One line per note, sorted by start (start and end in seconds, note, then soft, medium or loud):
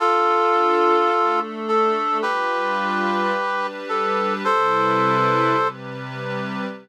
0.00 1.10 D4 medium
0.00 1.40 F4 medium
0.00 1.10 F4 medium
0.00 1.40 A4 medium
0.00 1.10 A4 medium
1.11 2.21 A3 medium
1.11 2.21 D4 medium
1.11 2.21 A4 medium
1.68 2.18 A4 medium
2.22 3.32 G3 loud
2.22 3.32 D4 medium
2.22 3.32 F4 medium
2.22 3.67 G4 medium
2.22 3.32 B4 loud
2.22 3.67 B4 medium
3.33 4.43 G3 medium
3.33 4.43 D4 medium
3.33 4.43 G4 loud
3.33 4.43 B4 loud
3.89 4.34 A4 medium
4.44 5.55 C3 medium
4.44 5.55 G3 loud
4.44 5.55 E4 medium
4.44 5.68 A4 medium
4.44 5.55 B4 loud
4.44 5.68 C5 medium
5.56 6.66 C3 medium
5.56 6.66 G3 loud
5.56 6.66 G4 medium
5.56 6.66 B4 loud